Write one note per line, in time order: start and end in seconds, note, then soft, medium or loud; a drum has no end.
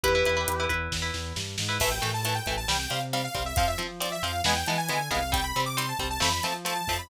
0.03 0.23 E2 loud
0.03 0.12 E4 loud
0.03 0.65 G4 medium
0.03 0.65 B4 loud
0.03 0.12 B4 loud
0.03 kick loud
0.03 closed hi-hat loud
0.15 0.24 E4 loud
0.15 0.24 B4 loud
0.25 0.45 E2 loud
0.25 0.35 E4 loud
0.25 0.35 B4 medium
0.25 closed hi-hat medium
0.37 0.54 E4 loud
0.37 0.54 B4 medium
0.48 0.67 E2 medium
0.48 closed hi-hat loud
0.60 0.68 E4 loud
0.60 0.68 B4 loud
0.69 0.88 E2 medium
0.69 0.96 E4 medium
0.69 0.96 B4 loud
0.69 kick medium
0.69 closed hi-hat medium
0.92 1.11 E2 loud
0.92 kick medium
0.92 snare medium
1.02 1.37 E4 loud
1.02 1.37 B4 medium
1.14 1.33 E2 medium
1.14 snare medium
1.36 1.56 G2 medium
1.36 snare medium
1.58 1.78 G#2 medium
1.58 snare loud
1.69 1.77 E4 medium
1.69 1.77 B4 loud
1.80 1.99 A1 medium
1.80 1.90 E3 loud
1.80 1.90 A3 loud
1.80 1.91 E5 medium
1.80 kick medium
1.80 crash loud
1.91 2.11 G5 medium
2.02 2.40 A2 medium
2.02 2.11 E3 medium
2.02 2.11 A3 loud
2.02 snare medium
2.02 closed hi-hat medium
2.14 2.24 A5 medium
2.25 2.34 E3 loud
2.25 2.34 A3 medium
2.25 2.35 A5 medium
2.25 closed hi-hat loud
2.35 2.54 G5 medium
2.46 2.65 A1 medium
2.46 2.56 E3 loud
2.46 2.56 A3 medium
2.46 kick medium
2.46 closed hi-hat medium
2.57 2.68 A5 medium
2.68 2.87 C2 medium
2.68 2.77 G3 loud
2.68 2.77 C4 loud
2.68 2.79 G5 medium
2.68 snare loud
2.79 2.90 G5 medium
2.90 3.28 C3 medium
2.90 2.99 G3 medium
2.90 2.99 C4 medium
2.90 3.01 F5 medium
2.90 closed hi-hat medium
3.13 3.22 G3 medium
3.13 3.22 C4 loud
3.13 3.24 F5 medium
3.13 closed hi-hat medium
3.24 3.43 F5 medium
3.34 3.53 C2 medium
3.34 3.43 G3 medium
3.34 3.43 C4 medium
3.34 kick medium
3.34 closed hi-hat medium
3.46 3.56 E5 medium
3.56 3.75 F2 medium
3.56 3.66 F3 loud
3.56 3.66 C4 loud
3.56 3.67 F5 loud
3.56 kick loud
3.56 closed hi-hat loud
3.68 3.78 E5 medium
3.78 3.87 F3 medium
3.78 4.16 F3 medium
3.78 3.87 C4 loud
3.78 snare soft
3.78 closed hi-hat medium
4.00 4.09 F3 medium
4.00 4.09 C4 loud
4.00 4.11 D5 medium
4.00 closed hi-hat loud
4.12 4.22 E5 medium
4.23 4.41 F2 medium
4.23 4.32 F3 medium
4.23 4.32 C4 medium
4.23 4.41 F5 medium
4.23 closed hi-hat medium
4.44 4.63 E2 medium
4.44 4.54 E3 loud
4.44 4.54 G#3 loud
4.44 4.54 B3 loud
4.44 4.56 G#5 loud
4.44 snare loud
4.56 4.66 G5 loud
4.66 4.88 E3 medium
4.66 4.77 E3 loud
4.66 4.77 G#3 loud
4.66 4.77 B3 loud
4.66 4.78 A5 medium
4.66 closed hi-hat medium
4.78 5.08 G#5 loud
4.89 5.09 D3 medium
4.89 4.98 E3 medium
4.89 4.98 G#3 medium
4.89 4.98 B3 medium
4.89 closed hi-hat medium
5.11 5.52 C2 loud
5.11 5.19 E3 loud
5.11 5.19 G#3 loud
5.11 5.19 B3 medium
5.11 5.30 F5 loud
5.11 kick medium
5.11 closed hi-hat medium
5.32 5.41 G3 loud
5.32 5.41 C4 loud
5.32 5.44 G5 loud
5.32 kick loud
5.32 closed hi-hat loud
5.44 5.61 B5 medium
5.56 5.93 C3 medium
5.56 5.65 G3 loud
5.56 5.65 C4 medium
5.56 snare medium
5.56 closed hi-hat medium
5.66 5.76 D6 medium
5.77 5.86 G3 loud
5.77 5.86 C4 loud
5.77 5.88 C6 medium
5.77 closed hi-hat loud
5.89 6.07 A5 medium
5.99 6.18 C2 medium
5.99 6.08 G3 medium
5.99 6.08 C4 loud
5.99 kick medium
5.99 closed hi-hat medium
6.10 6.21 A5 loud
6.20 6.40 F2 medium
6.20 6.29 F3 loud
6.20 6.29 A3 loud
6.20 6.29 C4 loud
6.20 6.32 B5 loud
6.20 snare loud
6.33 6.43 B5 medium
6.43 6.81 F3 medium
6.43 6.53 F3 medium
6.43 6.53 A3 medium
6.43 6.53 C4 loud
6.43 6.54 A5 medium
6.43 closed hi-hat medium
6.65 6.74 F3 medium
6.65 6.74 A3 medium
6.65 6.74 C4 medium
6.65 6.76 A5 loud
6.65 closed hi-hat medium
6.76 6.97 A5 medium
6.87 7.06 F2 medium
6.87 6.98 F3 medium
6.87 6.98 A3 medium
6.87 6.98 C4 medium
6.87 kick medium
6.87 open hi-hat medium
6.99 7.09 B5 medium